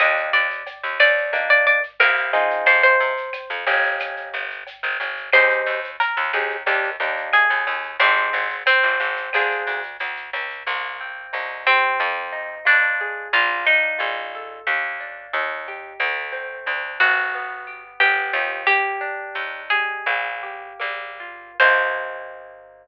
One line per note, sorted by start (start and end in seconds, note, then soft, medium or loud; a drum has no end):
0.00 0.30 D#2 medium
0.00 0.48 A#3 medium
0.00 0.48 D4 medium
0.00 0.48 D#4 medium
0.00 0.48 G4 medium
0.00 0.32 D#5 loud
0.00 cowbell medium
0.00 claves medium
0.00 shaker medium
0.17 shaker medium
0.33 0.63 D#2 medium
0.33 0.95 D5 medium
0.33 shaker medium
0.50 shaker medium
0.66 cowbell medium
0.66 shaker medium
0.83 0.98 D#2 medium
0.83 shaker medium
1.00 1.94 D#2 medium
1.00 1.41 D5 loud
1.00 claves medium
1.00 shaker medium
1.18 shaker soft
1.33 1.79 A#3 medium
1.33 1.79 D4 medium
1.33 1.79 D#4 loud
1.33 1.79 G4 medium
1.33 cowbell medium
1.33 shaker medium
1.50 1.66 D5 medium
1.50 shaker soft
1.66 1.83 D5 medium
1.66 shaker medium
1.83 shaker medium
2.00 2.61 C2 medium
2.00 2.32 A#3 medium
2.00 2.32 C4 loud
2.00 2.32 E4 medium
2.00 2.32 G4 medium
2.00 2.65 A#4 medium
2.00 cowbell medium
2.00 claves medium
2.00 shaker medium
2.16 shaker medium
2.33 3.13 C4 medium
2.33 3.13 D#4 medium
2.33 3.13 F4 loud
2.33 3.13 G#4 medium
2.33 cowbell medium
2.33 shaker medium
2.50 shaker medium
2.66 2.96 F2 medium
2.66 2.83 C5 loud
2.66 cowbell medium
2.66 shaker medium
2.83 4.81 C5 medium
2.83 shaker medium
3.00 3.30 C3 medium
3.00 shaker medium
3.17 shaker medium
3.33 cowbell soft
3.33 claves medium
3.33 shaker medium
3.50 3.65 F2 medium
3.50 shaker medium
3.66 4.30 G1 medium
3.66 4.47 A#3 medium
3.66 4.47 C#4 medium
3.66 4.47 D#4 loud
3.66 4.47 G4 loud
3.66 shaker medium
3.83 shaker medium
3.99 cowbell soft
3.99 claves medium
3.99 shaker medium
4.17 shaker medium
4.33 4.64 G1 medium
4.33 shaker medium
4.50 shaker medium
4.67 cowbell soft
4.67 shaker medium
4.83 4.98 G1 medium
4.83 shaker medium
5.00 5.30 G1 medium
5.00 cowbell medium
5.00 shaker medium
5.17 shaker medium
5.33 5.63 D#2 medium
5.33 5.80 C4 medium
5.33 5.80 D#4 loud
5.33 5.80 G4 medium
5.33 5.80 G#4 loud
5.33 5.91 C5 loud
5.33 cowbell medium
5.33 claves medium
5.33 shaker medium
5.50 shaker medium
5.66 5.96 D#2 medium
5.66 shaker medium
5.84 shaker medium
6.00 7.18 A#4 medium
6.00 cowbell medium
6.00 shaker medium
6.17 6.32 D#2 medium
6.17 shaker soft
6.33 6.63 D#2 medium
6.33 6.57 C4 medium
6.33 6.57 D#4 medium
6.33 6.57 G4 medium
6.33 6.57 G#4 medium
6.33 claves medium
6.33 shaker medium
6.50 shaker soft
6.66 6.97 D#2 medium
6.66 6.90 A#3 medium
6.66 6.90 D4 loud
6.66 6.90 D#4 loud
6.66 6.90 G4 medium
6.66 cowbell medium
6.66 shaker medium
6.84 shaker soft
7.00 7.30 D#2 medium
7.00 7.47 A#3 medium
7.00 7.47 D4 medium
7.00 7.47 D#4 medium
7.00 7.47 G4 medium
7.00 shaker medium
7.17 shaker medium
7.33 7.93 G#4 medium
7.33 cowbell medium
7.33 claves medium
7.33 shaker medium
7.50 7.65 D#2 medium
7.50 shaker medium
7.67 7.97 D#2 medium
7.67 cowbell medium
7.67 shaker medium
7.83 shaker soft
8.00 8.30 G#1 medium
8.00 8.56 C4 medium
8.00 8.48 C4 medium
8.00 8.48 D#4 loud
8.00 8.48 G4 medium
8.00 8.48 G#4 medium
8.00 cowbell medium
8.00 shaker medium
8.16 shaker soft
8.33 8.63 G#1 medium
8.33 shaker medium
8.50 shaker medium
8.66 9.84 C4 loud
8.66 cowbell medium
8.66 claves medium
8.66 shaker medium
8.83 8.98 G#1 medium
8.83 shaker medium
9.00 9.30 G#1 medium
9.00 shaker medium
9.16 shaker medium
9.33 9.64 D2 medium
9.33 9.81 C4 medium
9.33 9.81 D4 medium
9.33 9.81 F4 medium
9.33 9.81 G#4 loud
9.33 cowbell medium
9.33 claves medium
9.33 shaker medium
9.50 shaker medium
9.66 9.97 D2 medium
9.66 shaker medium
9.83 shaker medium
9.99 10.30 D2 medium
9.99 cowbell medium
9.99 shaker medium
10.16 shaker medium
10.33 10.63 C#2 medium
10.33 cowbell medium
10.33 shaker medium
10.50 shaker soft
10.67 11.27 C2 medium
10.67 11.93 A#3 medium
11.01 11.96 C4 medium
11.33 11.93 C2 medium
11.33 11.96 D#4 medium
11.67 12.55 C4 medium
11.67 11.98 G4 medium
12.00 12.60 F2 medium
12.00 13.26 C4 medium
12.33 13.28 D#4 medium
12.65 13.26 F2 medium
12.65 13.28 D4 medium
12.65 13.28 F4 medium
13.01 13.32 G#4 medium
13.33 13.93 A#1 medium
13.33 14.60 A#3 medium
13.33 13.65 F4 loud
13.65 14.60 D4 medium
13.65 14.60 D#4 medium
13.98 14.60 A#1 medium
13.98 14.62 F4 medium
14.35 14.66 A4 medium
14.67 15.27 D#2 medium
14.67 15.94 A#3 medium
15.00 15.95 D4 medium
15.33 15.93 D#2 medium
15.33 15.97 D#4 medium
15.68 16.00 G4 medium
16.00 16.60 D2 medium
16.00 17.27 A3 medium
16.32 17.27 C4 medium
16.66 16.98 D2 medium
16.66 17.30 D4 medium
17.00 17.93 G1 medium
17.00 17.83 F#4 medium
17.00 17.32 F#4 medium
17.34 18.00 B3 medium
17.67 18.62 G4 medium
18.00 18.32 G1 medium
18.00 18.63 B3 medium
18.00 18.63 G4 medium
18.33 19.28 D#2 medium
18.33 18.65 F4 medium
18.67 19.99 A#3 medium
18.67 19.61 G4 loud
19.01 20.01 D4 medium
19.35 19.99 D#2 medium
19.35 20.03 D#4 medium
19.70 20.05 G4 medium
19.70 20.67 G#4 medium
20.06 20.73 A#1 medium
20.06 20.79 A#3 medium
20.43 21.53 G4 medium
20.79 21.52 A#1 medium
20.79 21.54 A#3 medium
21.20 21.58 F4 medium
21.60 22.87 C2 medium
21.60 22.87 A#3 medium
21.60 22.87 C4 medium
21.60 22.87 D#4 medium
21.60 22.87 G4 medium
21.60 22.87 C5 loud